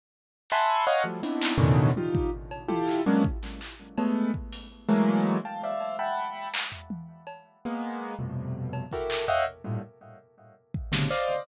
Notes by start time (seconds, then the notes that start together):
0.50 E5 F#5 G#5 A5 B5 C6, clap
0.87 C#5 D#5 F5 F#5
1.04 F3 F#3 G3 A3
1.23 B3 C4 D4 D#4 E4, closed hi-hat
1.41 clap
1.58 A2 B2 C#3 D3 D#3 E3, floor tom
1.96 D#4 F4 G4, high tom
2.15 kick
2.51 cowbell
2.68 E4 F4 G4 A4, high tom
2.88 clap
3.06 F#3 G#3 A#3 B3 C#4 D4
3.24 kick
3.43 clap
3.61 clap
3.98 G#3 A3 B3, cowbell
4.34 kick
4.52 closed hi-hat
4.88 E3 F#3 G#3 A3 A#3
5.45 F5 G5 A5
5.63 C5 D5 E5 F5
5.80 cowbell
5.99 E5 F#5 G5 A5 B5
6.54 clap
6.72 floor tom
6.90 high tom
7.27 cowbell
7.65 G#3 A#3 B3
8.19 F2 G2 A2 B2 C3
8.73 cowbell
8.91 E4 F#4 G4 A4 A#4, kick
9.10 clap
9.28 C#5 D#5 E5 F5 F#5 G5, floor tom
9.64 G2 A2 A#2
10.74 kick
10.92 A2 B2 C3 C#3 D3, snare
11.10 C5 D5 D#5 F5, clap